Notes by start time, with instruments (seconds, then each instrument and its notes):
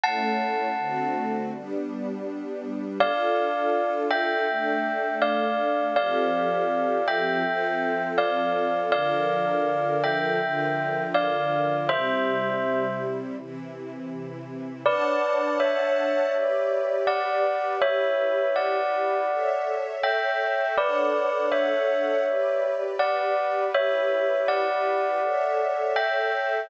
0.04 string ensemble 1 A3 C#4 E4, tubular bells F#5 A5
0.78 string ensemble 1 D3 A3 C4 F#4
1.52 string ensemble 1 G3 B3 D4
3.00 string ensemble 1 D4 F4 A4, tubular bells D5 F5
4.10 tubular bells E5 G5
4.48 string ensemble 1 A3 D4 A4
5.22 tubular bells D5 F5
5.96 string ensemble 1 F3 C4 G4 A4, tubular bells D5 F5
7.08 tubular bells E5 G5
7.44 string ensemble 1 F3 C4 F4 A4
8.18 tubular bells D5 F5
8.92 string ensemble 1 D3 F3 A4 A#4, tubular bells D5 F5
10.04 tubular bells E5 G5
10.41 string ensemble 1 D3 F3 F4 A#4
11.14 tubular bells D5 F5
11.89 string ensemble 1 C3 G3 E4, tubular bells C5 E5
13.37 string ensemble 1 C3 E3 E4
14.85 string ensemble 1 D4 C#5 F#5 A5, tubular bells B4 D5
15.60 tubular bells C#5 E5
16.33 string ensemble 1 G4 B4 D5
17.07 tubular bells D5 F#5
17.81 string ensemble 1 E4 G4 B4, tubular bells C#5 E5
18.56 tubular bells D5 F#5
19.29 string ensemble 1 A4 C#5 E5
20.03 tubular bells E5 G5
20.77 string ensemble 1 D4 A4 C#5 F#5, tubular bells B4 D5
21.52 tubular bells C#5 E5
22.26 string ensemble 1 G4 B4 D5
22.99 tubular bells D5 F#5
23.74 string ensemble 1 E4 G4 B4, tubular bells C#5 E5
24.48 tubular bells D5 F#5
25.22 string ensemble 1 A4 C#5 E5
25.96 tubular bells E5 G5